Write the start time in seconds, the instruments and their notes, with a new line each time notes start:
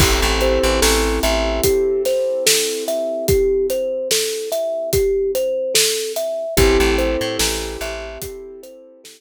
0.00 electric bass (finger) A1, acoustic grand piano C4 E4 G4 A4, kalimba G4, kick, crash
0.22 electric bass (finger) A1
0.41 kalimba C5, closed hi-hat
0.64 electric bass (finger) A1
0.82 electric bass (finger) A1, kalimba A4, snare
1.23 electric bass (finger) A1, kalimba E5, closed hi-hat
1.64 kalimba G4, kick, closed hi-hat
2.05 kalimba C5, snare, closed hi-hat
2.46 kalimba A4, snare
2.88 kalimba E5, closed hi-hat
3.28 kalimba G4, kick, closed hi-hat
3.70 kalimba C5, closed hi-hat
4.11 kalimba A4, snare
4.52 kalimba E5, closed hi-hat
4.93 kalimba G4, kick, closed hi-hat
5.35 kalimba C5, closed hi-hat
5.74 kalimba A4, snare
6.16 kalimba E5, closed hi-hat
6.57 electric bass (finger) A1, acoustic grand piano C4 E4 G4 A4, kalimba G4, kick, closed hi-hat
6.80 electric bass (finger) A1
6.98 kalimba C5, closed hi-hat
7.21 electric bass (finger) A2
7.39 electric bass (finger) A1, kalimba A4, snare
7.81 electric bass (finger) A1, kalimba E5, closed hi-hat
8.22 kalimba G4, kick, closed hi-hat
8.63 kalimba C5, closed hi-hat
9.04 kalimba A4, snare